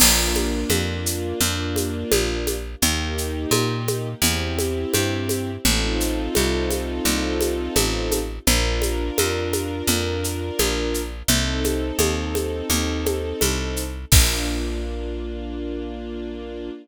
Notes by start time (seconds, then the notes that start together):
0.00 A#1 A#3 D4 F4, crash, low conga, shaker
0.35 high conga, shaker
0.70 F2, high conga, shaker
1.06 shaker
1.41 F2, low conga, shaker
1.76 high conga, shaker
2.12 A#1, high conga, shaker
2.47 high conga, shaker
2.82 D#2 A#3 D#4 G4, low conga, shaker
3.18 shaker
3.51 A#2, high conga, shaker
3.88 high conga, shaker
4.22 E2 C4 E4 G4, low conga, shaker
4.59 high conga, shaker
4.94 G2, high conga, shaker
5.29 high conga, shaker
5.65 A1 C4 D#4 F4 A4, low conga, shaker
6.00 shaker
6.35 C2, high conga, shaker
6.70 high conga, shaker
7.05 C2, low conga, shaker
7.41 high conga, shaker
7.76 A1, high conga, shaker
8.11 high conga, shaker
8.47 A#1 D4 F4 A#4, low conga, shaker
8.82 high conga, shaker
9.18 F2, high conga, shaker
9.53 high conga, shaker
9.87 F2, low conga, shaker
10.24 shaker
10.59 A#1, high conga, shaker
10.94 shaker
11.28 C2 C4 D#4 A4, low conga, shaker
11.64 high conga, shaker
11.99 D#2, high conga, shaker
12.35 high conga, shaker
12.70 D#2, low conga, shaker
13.06 high conga, shaker
13.41 C2, high conga, shaker
13.76 shaker
14.12 A#1 A#3 D4 F4, kick, crash